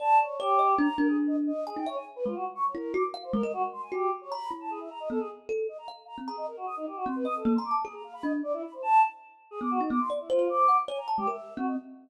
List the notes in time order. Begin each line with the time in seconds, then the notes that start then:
0.00 D5 A5
0.19 C#5
0.39 G4 C#5
0.59 D#5
0.78 D4 A#5
0.98 D4 A#4
1.08 G#4
1.27 D#5
1.47 D#5
1.67 G#4 G#5
1.76 D#4 G5
1.86 C#5 E5
1.96 G#5
2.16 B4
2.25 G#3 F4
2.35 F#4
2.55 C#6
2.64 C#5
2.74 E4 A#4
2.94 F#4 D6
3.14 F5
3.23 C5
3.33 G#3 A#4
3.43 A#4 D#5
3.53 F#4
3.72 C6
3.82 G#5
3.92 F#4 G4
4.21 C#5
4.31 A#5 B5
4.51 E4
4.61 A5
4.70 G#4
4.80 E5
4.90 A#5
5.00 D#5
5.10 B3 A4
5.19 G#4
5.49 A4
5.68 D#5
5.78 A#5
5.88 F5
6.07 A#5
6.18 C4
6.27 G#4 A#5
6.37 D#5
6.47 A#4
6.57 F#4
6.66 D#6
6.77 D#4
6.87 G4
6.96 F#4
7.06 C4 C6
7.16 B4
7.25 D#5 D#6
7.35 A4
7.45 A#3
7.55 A#5 C6
7.65 D6
7.71 A5
7.84 G#4
7.94 A#5
8.04 F5
8.14 B5
8.23 D4 D#5
8.43 D5
8.53 E4
8.63 B5
8.73 C5
8.82 A5
9.51 G#4
9.61 B3 D6
9.71 F#4
9.81 D#4
9.90 B3 D6
10.00 C6
10.10 D5
10.20 E4
10.29 F4 C5
10.39 C5
10.49 D6
10.68 F#5
10.88 C#5 G#5
10.98 A#5
11.08 A5
11.17 G#3 G4
11.27 A#4 E5
11.57 C4 F#4
11.67 D#5